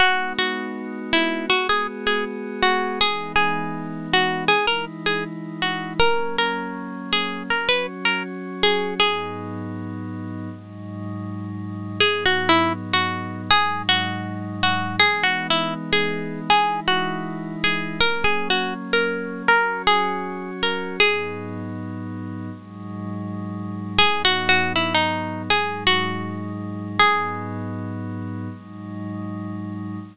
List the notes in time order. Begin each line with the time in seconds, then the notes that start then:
0.00 G#3 B3 D#4 F#4
0.39 F#4
1.13 E4
1.50 G#3 B3 F#4 G#4
1.69 G#4
2.07 G#4
2.62 F#4
3.01 E3 G#3 B3 D#4 G#4
3.36 G#4
4.13 F#4
4.48 E3 G#3 D#4 E4 G#4
4.67 A#4
5.06 G#4
5.62 F#4
6.00 F#3 A#3 C#4 A#4
6.38 A#4
7.13 G#4
7.50 F#3 C#4 F#4 A#4
7.69 B4
8.05 A#4
8.63 G#4
9.00 G#2 F#3 B3 D#4 G#4
10.50 G#2 F#3 G#3 D#4
12.00 G#2 F#3 B3 D#4 G#4
12.26 F#4
12.49 E4
12.93 F#4
13.50 G#2 F#3 G#3 D#4 G#4
13.89 F#4
14.63 F#4
15.00 E3 G#3 B3 D#4 G#4
15.23 F#4
15.50 E4
15.93 G#4
16.49 E3 G#3 D#4 E4 G#4
16.88 F#4
17.64 G#4
17.99 F#3 A#3 C#4 A#4
18.24 G#4
18.50 F#4
18.93 A#4
19.48 F#3 C#4 F#4 A#4
19.87 G#4
20.63 A#4
21.00 G#2 F#3 B3 D#4 G#4
22.51 G#2 F#3 G#3 D#4
23.98 G#2 F#3 B3 D#4 G#4
24.25 F#4
24.49 F#4
24.76 E4
24.95 D#4
25.50 G#2 F#3 G#3 D#4 G#4
25.87 F#4
26.99 G#2 F#3 B3 D#4 G#4
28.49 G#2 F#3 G#3 D#4